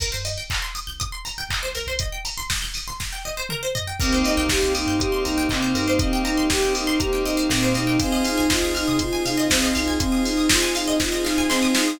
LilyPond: <<
  \new Staff \with { instrumentName = "Ocarina" } { \time 4/4 \key c \minor \tempo 4 = 120 r1 | r1 | c'8 ees'8 g'8 ees'8 g'8 ees'8 c'8 ees'8 | c'8 ees'8 g'8 ees'8 g'8 ees'8 c'8 ees'8 |
c'8 ees'8 f'8 ees'8 f'8 ees'8 c'8 ees'8 | c'8 ees'8 f'8 ees'8 f'8 ees'8 c'8 ees'8 | }
  \new Staff \with { instrumentName = "Electric Piano 2" } { \time 4/4 \key c \minor r1 | r1 | <bes c' ees' g'>4 <bes c' ees' g'>4 <bes c' ees' g'>4 <bes c' ees' g'>4 | <bes c' ees' g'>4 <bes c' ees' g'>4 <bes c' ees' g'>4 <bes c' ees' g'>4 |
<c'' ees'' f'' aes''>4 <c'' ees'' f'' aes''>4 <c'' ees'' f'' aes''>4 <c'' ees'' f'' aes''>4 | <c'' ees'' f'' aes''>4 <c'' ees'' f'' aes''>4 <c'' ees'' f'' aes''>4 <c'' ees'' f'' aes''>4 | }
  \new Staff \with { instrumentName = "Pizzicato Strings" } { \time 4/4 \key c \minor bes'16 c''16 ees''16 g''16 bes''16 c'''16 ees'''16 g'''16 ees'''16 c'''16 bes''16 g''16 ees''16 c''16 bes'16 c''16 | ees''16 g''16 bes''16 c'''16 ees'''16 g'''16 ees'''16 c'''16 bes''16 g''16 ees''16 c''16 bes'16 c''16 ees''16 g''16 | bes'16 c''16 ees''16 g''16 bes''16 c'''16 ees'''16 g'''16 ees'''16 c'''16 bes''16 g''16 ees''16 c''16 bes'16 c''16 | ees''16 g''16 bes''16 c'''16 ees'''16 g'''16 ees'''16 c'''16 bes''16 g''16 ees''16 c''16 bes'16 c''16 ees''16 g''16 |
c''16 ees''16 f''16 aes''16 c'''16 ees'''16 f'''16 ees'''16 c'''16 aes''16 f''16 ees''16 c''16 ees''16 f''16 aes''16 | c'''16 ees'''16 f'''16 ees'''16 c'''16 aes''16 f''16 ees''16 c''16 ees''16 f''16 aes''16 c'''16 ees'''16 f'''16 ees'''16 | }
  \new Staff \with { instrumentName = "Synth Bass 1" } { \clef bass \time 4/4 \key c \minor c,16 g,4. c,4~ c,16 c,16 c,16 c,16 c,16~ | c,1 | c,8. c,8 c,8 g,8. c,8 c8 g,8~ | g,2. bes,8 b,8 |
c,8. c,8 c,8 c8. c8 c,8 c,8~ | c,1 | }
  \new Staff \with { instrumentName = "Pad 2 (warm)" } { \time 4/4 \key c \minor r1 | r1 | <bes c' ees' g'>1~ | <bes c' ees' g'>1 |
<c' ees' f' aes'>1~ | <c' ees' f' aes'>1 | }
  \new DrumStaff \with { instrumentName = "Drums" } \drummode { \time 4/4 <cymc bd>8 hho8 <hc bd>8 hho8 <hh bd>8 hho8 <hc bd>8 hho8 | <hh bd>8 hho8 <bd sn>8 hho8 <bd sn>4 toml8 tomfh8 | <cymc bd>8 hho8 <bd sn>8 hho8 <hh bd>8 hho8 <hc bd>8 hho8 | <hh bd>8 hho8 <bd sn>8 hho8 <hh bd>8 hho8 <bd sn>8 hho8 |
<hh bd>8 hho8 <bd sn>8 hho8 <hh bd>8 hho8 <bd sn>8 hho8 | <hh bd>8 hho8 <bd sn>8 hho8 <bd sn>8 sn8 sn8 sn8 | }
>>